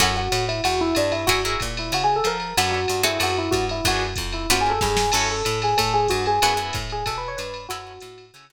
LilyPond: <<
  \new Staff \with { instrumentName = "Electric Piano 1" } { \time 4/4 \key fis \minor \tempo 4 = 187 fis'8 fis'4 e'8 fis'8 e'8 d'8 e'8 | fis'8 r4 e'8 \tuplet 3/2 { fis'8 gis'8 a'8 } ais'4 | fis'8 fis'4 e'8 fis'8 e'8 fis'8 e'8 | fis'8 r4 e'8 \tuplet 3/2 { fis'8 gis'8 a'8 } gis'4 |
a'8 a'4 gis'8 a'8 gis'8 fis'8 gis'8 | gis'8 r4 gis'8 \tuplet 3/2 { a'8 b'8 cis''8 } b'4 | fis'2 r2 | }
  \new Staff \with { instrumentName = "Acoustic Guitar (steel)" } { \time 4/4 \key fis \minor <cis' e' fis' a'>1 | <e' fis' gis' ais'>8 <e' fis' gis' ais'>2.~ <e' fis' gis' ais'>8 | <cis' d' a' b'>4. <bis fis' gis' a'>2~ <bis fis' gis' a'>8 | <b d' fis' gis'>2 <ais b cis' eis'>2 |
<cis' e' fis' a'>1 | <b e' fis' gis'>8 <b e' fis' gis'>2.~ <b e' fis' gis'>8 | <cis' e' fis' a'>2 <cis' e' fis' a'>8 <cis' e' fis' a'>4. | }
  \new Staff \with { instrumentName = "Electric Bass (finger)" } { \clef bass \time 4/4 \key fis \minor fis,4 a,4 e,4 g,4 | fis,4 ais,4 cis4 eis4 | fis,4 g,4 fis,4 g,4 | fis,4 eis,4 fis,4 g,4 |
fis,4 a,4 a,4 g,4 | fis,4 a,4 b,4 g,4 | fis,4 a,4 cis4 r4 | }
  \new DrumStaff \with { instrumentName = "Drums" } \drummode { \time 4/4 <bd cymr>4 <hhp cymr>8 cymr8 cymr4 <hhp cymr>8 cymr8 | <bd cymr>4 <hhp bd cymr>8 cymr8 cymr4 <hhp cymr>8 cymr8 | cymr4 <hhp cymr>8 cymr8 cymr4 <hhp bd cymr>8 cymr8 | <bd cymr>4 <hhp bd cymr>8 cymr8 cymr4 <bd sn>8 sn8 |
<cymc cymr>4 <hhp cymr>8 cymr8 <bd cymr>4 <hhp bd cymr>8 cymr8 | cymr4 <hhp bd cymr>8 cymr8 <bd cymr>4 <hhp cymr>8 cymr8 | cymr4 <hhp cymr>8 cymr8 cymr4 r4 | }
>>